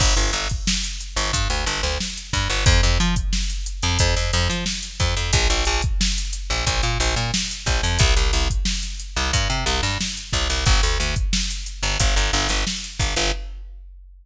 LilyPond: <<
  \new Staff \with { instrumentName = "Electric Bass (finger)" } { \clef bass \time 4/4 \key g \dorian \tempo 4 = 90 g,,16 g,,16 g,,4~ g,,16 g,,16 g,16 d,16 g,,16 d,8. g,16 g,,16 | f,16 f,16 f4~ f16 f,16 f,16 f,16 f,16 f8. f,16 f,16 | bes,,16 bes,,16 bes,,4~ bes,,16 bes,,16 bes,,16 bes,16 bes,,16 bes,8. bes,,16 f,16 | c,16 c,16 c,4~ c,16 c,16 g,16 c16 c,16 g,8. c,16 c,16 |
g,,16 d,16 d,4~ d,16 g,,16 g,,16 g,,16 g,,16 g,,8. g,,16 g,,16 | }
  \new DrumStaff \with { instrumentName = "Drums" } \drummode { \time 4/4 <cymc bd>16 hh16 <hh sn>16 <hh bd>16 sn16 hh16 hh16 hh16 <hh bd>16 hh16 <hh sn>16 <hh sn>16 sn16 hh16 <hh bd>16 hh16 | <hh bd>16 hh16 hh16 <hh bd>16 sn16 hh16 hh16 hh16 <hh bd>16 hh16 hh16 <hh sn>16 sn16 hh16 <hh bd>16 hh16 | <hh bd>16 hh16 hh16 <hh bd>16 sn16 hh16 hh16 hh16 <hh bd>16 hh16 hh16 <hh sn>16 sn16 hh16 <hh bd sn>16 hh16 | <hh bd>16 hh16 hh16 <hh bd>16 sn16 <hh sn>16 hh16 hh16 <hh bd>16 hh16 hh16 <hh sn>16 sn16 hh16 <hh bd>16 hh16 |
<hh bd>16 hh16 hh16 <hh bd>16 sn16 hh16 hh16 hh16 <hh bd>16 hh16 hh16 <hh sn>16 sn16 hh16 <hh bd>16 hh16 | }
>>